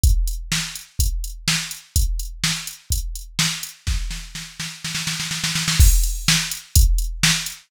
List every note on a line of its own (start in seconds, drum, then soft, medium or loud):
0.04 kick loud
0.04 closed hi-hat medium
0.28 closed hi-hat medium
0.52 snare loud
0.76 closed hi-hat medium
0.99 kick medium
0.99 closed hi-hat loud
1.24 closed hi-hat medium
1.48 snare loud
1.71 closed hi-hat medium
1.96 kick medium
1.96 closed hi-hat loud
2.19 closed hi-hat medium
2.44 snare loud
2.67 closed hi-hat medium
2.90 kick medium
2.90 closed hi-hat loud
3.16 closed hi-hat medium
3.39 snare loud
3.63 closed hi-hat medium
3.87 kick medium
3.87 snare medium
4.11 snare medium
4.35 snare medium
4.60 snare medium
4.84 snare medium
4.95 snare medium
5.07 snare medium
5.20 snare medium
5.31 snare medium
5.44 snare medium
5.55 snare medium
5.68 snare loud
5.80 kick loud
5.80 crash loud
6.03 closed hi-hat medium
6.28 snare loud
6.51 closed hi-hat medium
6.75 kick loud
6.75 closed hi-hat loud
6.98 closed hi-hat medium
7.23 snare loud
7.46 closed hi-hat medium